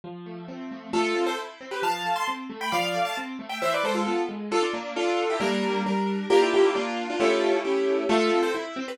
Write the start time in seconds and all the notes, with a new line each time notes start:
0.04 F3
0.26 A3
0.48 C4
0.71 A3
0.93 A3 F4 A4
1.15 C4
1.26 A4 C5
1.39 E4
1.61 C4
1.71 G4 B4
1.82 F3 F5 A5
2.05 A3
2.16 A5 C6
2.28 C4
2.50 A3
2.61 G5 B5
2.72 F3 D5 F5
2.94 A3
3.05 F5 A5
3.17 C4
3.39 A3
3.49 E5 G5
3.62 E3 C5 E5
3.74 B4 D5
3.83 G#3 A4 C5
3.95 F4 A4
4.07 B3
4.29 G#3
4.51 D4 F4 A4
4.62 D4 F4
4.74 A#3 D4
4.96 D4 F4 A4
5.30 E4 G4
5.40 G3 A#3 D4 A#4
5.86 G3 D4 A#4
6.30 A#3 D4 F4 G4 A#4
6.42 E4 G4
6.54 E4 G4
6.75 A#3 D4 F4
7.10 D4 F4
7.20 A3 C#4 E4 F4 G4 A4
7.65 A3 C#4 E4 G4
8.09 A3 F4 A4
8.32 C4
8.43 A4 C5
8.55 E4
8.76 C4
8.88 G4 B4